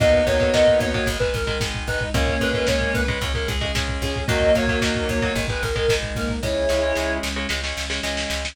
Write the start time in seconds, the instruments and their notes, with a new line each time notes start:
0.00 electric bass (finger) D#2, overdriven guitar D#3 F#3 A#3, pad 2 (warm) A#3 D#4 F#4, lead 1 (square) B3 D#4, distortion guitar D#5, kick, closed hi-hat
0.13 kick
0.26 electric bass (finger) D#2, overdriven guitar D#3 F#3 A#3, distortion guitar C#5, kick, closed hi-hat
0.40 overdriven guitar D#3 F#3 A#3, kick
0.54 electric bass (finger) D#2, overdriven guitar D#3 F#3 A#3, distortion guitar D#5, kick, snare
0.67 kick
0.79 electric bass (finger) D#2, distortion guitar C#5, kick, closed hi-hat
0.94 overdriven guitar D#3 F#3 A#3, kick
1.06 electric bass (finger) G#1, overdriven guitar D#3 G#3, pad 2 (warm) G#3 D#4, kick, closed hi-hat
1.20 overdriven guitar D#3 G#3, distortion guitar B4, kick
1.34 electric bass (finger) G#1, distortion guitar A#4, kick, closed hi-hat
1.47 overdriven guitar D#3 G#3, distortion guitar A#4, kick
1.60 electric bass (finger) G#1, overdriven guitar D#3 G#3, kick, snare
1.74 kick
1.87 electric bass (finger) G#1, lead 1 (square) D#4, distortion guitar B4, kick, closed hi-hat
2.01 kick
2.14 electric bass (finger) C#2, overdriven guitar C#3 G#3, pad 2 (warm) G#3 C#4, lead 1 (square) A#3 C#4, distortion guitar C#5, kick, closed hi-hat
2.27 kick
2.40 electric bass (finger) C#2, overdriven guitar C#3 G#3, distortion guitar B4, kick, closed hi-hat
2.53 overdriven guitar C#3 G#3, kick
2.67 electric bass (finger) C#2, overdriven guitar C#3 G#3, distortion guitar C#5, kick, snare
2.81 kick
2.94 electric bass (finger) C#2, distortion guitar B4, kick, closed hi-hat
3.08 overdriven guitar C#3 G#3, kick
3.21 electric bass (finger) C#2, overdriven guitar C#3 G#3, pad 2 (warm) G#3 C#4, kick, closed hi-hat
3.34 overdriven guitar C#3 G#3, distortion guitar A#4, kick
3.48 electric bass (finger) C#2, distortion guitar G#4, kick, closed hi-hat
3.61 overdriven guitar C#3 G#3, distortion guitar G#4, kick
3.75 electric bass (finger) C#2, overdriven guitar C#3 G#3, kick, snare
3.88 kick
4.02 electric bass (finger) C#2, lead 1 (square) C#4, distortion guitar G#4, kick, closed hi-hat
4.16 kick
4.28 electric bass (finger) D#2, overdriven guitar D#3 F#3 A#3, lead 1 (square) F#3 A#3, pad 2 (warm) F#3 A#3 D#4, distortion guitar D#5, kick, closed hi-hat
4.41 kick
4.54 electric bass (finger) D#2, overdriven guitar D#3 F#3 A#3, distortion guitar C#5, kick, closed hi-hat
4.67 overdriven guitar D#3 F#3 A#3, kick
4.81 electric bass (finger) D#2, overdriven guitar D#3 F#3 A#3, distortion guitar D#5, kick, snare
4.95 kick
5.09 electric bass (finger) D#2, distortion guitar C#5, kick, closed hi-hat
5.21 overdriven guitar D#3 F#3 A#3, kick
5.35 electric bass (finger) G#1, overdriven guitar D#3 G#3, pad 2 (warm) G#3 D#4, kick, closed hi-hat
5.48 overdriven guitar D#3 G#3, distortion guitar B4, kick
5.62 electric bass (finger) G#1, distortion guitar A#4, kick, closed hi-hat
5.76 overdriven guitar D#3 G#3, distortion guitar A#4, kick
5.88 electric bass (finger) G#1, overdriven guitar D#3 G#3, kick, snare
6.03 kick
6.15 electric bass (finger) G#1, lead 1 (square) A#3, distortion guitar A#4, kick, closed hi-hat
6.29 kick
6.42 electric bass (finger) C#2, overdriven guitar C#3 G#3, pad 2 (warm) G#3 C#4, lead 1 (square) E4 G#4, distortion guitar C#5, kick, snare
6.69 electric bass (finger) C#2, overdriven guitar C#3 G#3, snare
6.83 overdriven guitar C#3 G#3
6.95 electric bass (finger) C#2, overdriven guitar C#3 G#3, snare
7.23 electric bass (finger) C#2, snare
7.36 overdriven guitar C#3 G#3
7.49 electric bass (finger) C#2, overdriven guitar C#3 G#3, pad 2 (warm) G#3 C#4, snare
7.64 overdriven guitar C#3 G#3, snare
7.77 electric bass (finger) C#2, snare
7.90 overdriven guitar C#3 G#3, snare
8.03 electric bass (finger) C#2, overdriven guitar C#3 G#3, snare
8.17 snare
8.30 electric bass (finger) C#2, snare
8.45 snare